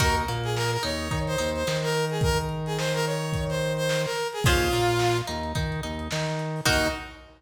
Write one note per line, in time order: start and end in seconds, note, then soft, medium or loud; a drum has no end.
0.00 0.25 D#2 medium
0.00 0.22 D#4 medium
0.00 0.22 F#4 medium
0.00 0.15 A#4 medium
0.00 0.22 A#4 medium
0.00 kick loud
0.00 crash loud
0.17 closed hi-hat medium
0.28 0.77 A#2 medium
0.28 0.77 A#3 medium
0.28 closed hi-hat medium
0.44 0.55 G#4 medium
0.44 closed hi-hat medium
0.56 0.71 A#4 medium
0.56 snare loud
0.72 0.83 A#4 medium
0.72 closed hi-hat medium
0.83 1.09 D#2 medium
0.83 1.07 D#4 medium
0.83 1.19 C#5 medium
0.83 closed hi-hat loud
0.99 closed hi-hat medium
1.11 1.36 D#3 medium
1.11 1.35 D#4 medium
1.11 kick loud
1.11 closed hi-hat loud
1.27 1.50 C5 medium
1.27 closed hi-hat medium
1.38 1.64 D#2 medium
1.38 1.63 D#4 medium
1.38 closed hi-hat loud
1.55 1.77 C5 medium
1.55 closed hi-hat medium
1.67 4.06 D#3 medium
1.67 4.06 D#4 medium
1.67 snare loud
1.83 2.05 A#4 medium
1.83 snare medium
1.83 closed hi-hat medium
1.94 closed hi-hat medium
2.10 2.22 G#4 medium
2.10 closed hi-hat medium
2.21 2.38 A#4 medium
2.21 kick loud
2.21 closed hi-hat loud
2.38 closed hi-hat medium
2.49 closed hi-hat medium
2.66 2.77 G#4 medium
2.66 closed hi-hat medium
2.78 2.93 C5 medium
2.78 snare loud
2.94 3.05 A#4 medium
2.94 closed hi-hat medium
3.05 3.44 C#5 medium
3.05 closed hi-hat medium
3.21 snare soft
3.21 closed hi-hat medium
3.33 kick loud
3.33 closed hi-hat loud
3.49 3.73 C5 medium
3.49 snare soft
3.49 closed hi-hat medium
3.61 snare soft
3.61 closed hi-hat medium
3.77 4.02 C5 medium
3.77 closed hi-hat medium
3.89 snare loud
4.05 4.27 A#4 medium
4.05 snare medium
4.05 closed hi-hat medium
4.16 snare soft
4.16 closed hi-hat medium
4.33 4.44 G#4 medium
4.33 closed hi-hat medium
4.44 4.70 D#2 medium
4.44 4.69 C#4 medium
4.44 5.17 F4 loud
4.44 4.69 F4 medium
4.44 4.69 G#4 medium
4.44 4.69 C5 medium
4.44 kick loud
4.44 closed hi-hat loud
4.60 snare soft
4.60 closed hi-hat medium
4.72 5.21 A#2 medium
4.72 5.21 A#3 medium
4.72 closed hi-hat medium
4.89 closed hi-hat medium
4.99 snare loud
5.16 snare soft
5.16 closed hi-hat medium
5.27 5.53 D#2 medium
5.27 5.52 D#4 medium
5.27 closed hi-hat medium
5.43 closed hi-hat medium
5.55 5.81 D#3 medium
5.55 5.80 D#4 medium
5.55 kick loud
5.55 closed hi-hat loud
5.72 closed hi-hat medium
5.83 6.09 D#2 medium
5.83 6.07 D#4 medium
5.83 closed hi-hat medium
5.99 closed hi-hat medium
6.11 6.61 D#3 medium
6.11 6.61 D#4 medium
6.11 snare loud
6.27 snare medium
6.27 closed hi-hat medium
6.39 closed hi-hat medium
6.56 open hi-hat medium
6.65 6.89 D#2 loud
6.65 6.86 D#4 loud
6.65 6.88 D#4 loud
6.65 6.86 F#4 loud
6.65 6.86 A#4 loud
6.65 kick loud
6.65 crash loud